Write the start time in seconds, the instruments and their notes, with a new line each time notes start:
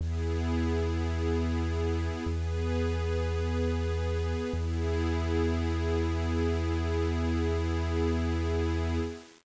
0.00 synth bass 2 E2, pad 2 (warm) B3 E4 G#4
2.26 synth bass 2 E2, pad 2 (warm) B3 G#4 B4
4.53 synth bass 2 E2, pad 2 (warm) B3 E4 G#4